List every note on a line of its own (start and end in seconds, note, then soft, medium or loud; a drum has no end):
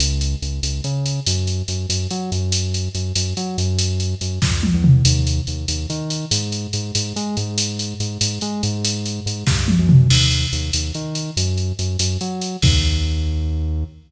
0.00 0.36 C#2 medium
0.00 closed hi-hat loud
0.21 closed hi-hat medium
0.42 0.60 C#2 medium
0.42 closed hi-hat medium
0.63 0.81 C#2 medium
0.63 closed hi-hat loud
0.84 1.20 C#3 medium
0.84 closed hi-hat medium
1.06 closed hi-hat medium
1.26 1.63 F#2 medium
1.26 closed hi-hat loud
1.47 closed hi-hat medium
1.68 1.86 F#2 medium
1.68 closed hi-hat medium
1.89 2.07 F#2 medium
1.89 closed hi-hat loud
2.11 2.31 F#3 medium
2.11 closed hi-hat medium
2.32 2.89 F#2 medium
2.32 closed hi-hat medium
2.52 closed hi-hat loud
2.74 closed hi-hat medium
2.95 3.13 F#2 medium
2.95 closed hi-hat medium
3.16 3.34 F#2 medium
3.16 closed hi-hat loud
3.37 3.57 F#3 medium
3.37 closed hi-hat medium
3.58 4.15 F#2 medium
3.58 closed hi-hat medium
3.79 closed hi-hat loud
4.00 closed hi-hat medium
4.21 4.39 F#2 medium
4.21 closed hi-hat medium
4.42 4.70 F2 medium
4.42 kick loud
4.42 snare medium
4.63 high tom loud
4.74 5.02 E2 medium
4.84 mid tom loud
5.05 5.41 D#2 medium
5.05 closed hi-hat loud
5.27 closed hi-hat medium
5.47 5.66 D#2 medium
5.47 closed hi-hat medium
5.68 5.86 D#2 medium
5.68 closed hi-hat loud
5.90 6.25 D#3 medium
5.90 closed hi-hat medium
6.10 closed hi-hat medium
6.31 6.67 G#2 medium
6.31 closed hi-hat loud
6.52 closed hi-hat medium
6.73 6.92 G#2 medium
6.73 closed hi-hat medium
6.95 7.13 G#2 medium
6.95 closed hi-hat loud
7.16 7.36 G#3 medium
7.16 closed hi-hat medium
7.37 7.94 G#2 medium
7.37 closed hi-hat medium
7.58 closed hi-hat loud
7.79 closed hi-hat medium
8.00 8.18 G#2 medium
8.00 closed hi-hat medium
8.21 8.39 G#2 medium
8.21 closed hi-hat loud
8.41 8.62 G#3 medium
8.41 closed hi-hat medium
8.63 9.20 G#2 medium
8.63 closed hi-hat medium
8.85 closed hi-hat loud
9.06 closed hi-hat medium
9.26 9.44 G#2 medium
9.26 closed hi-hat medium
9.47 9.76 G2 medium
9.47 kick loud
9.47 snare medium
9.68 high tom loud
9.79 10.07 F#2 medium
9.89 mid tom loud
10.10 10.46 D#2 medium
10.10 crash loud
10.31 closed hi-hat medium
10.53 10.71 D#2 medium
10.53 closed hi-hat medium
10.73 10.92 D#2 medium
10.73 closed hi-hat loud
10.94 11.31 D#3 medium
10.94 closed hi-hat medium
11.15 closed hi-hat medium
11.37 11.72 F#2 medium
11.37 closed hi-hat loud
11.58 closed hi-hat medium
11.79 11.97 F#2 medium
11.79 closed hi-hat medium
11.99 12.18 F#2 medium
11.99 closed hi-hat loud
12.21 12.57 F#3 medium
12.21 closed hi-hat medium
12.41 closed hi-hat medium
12.62 13.84 D#2 loud
12.62 kick loud
12.62 crash loud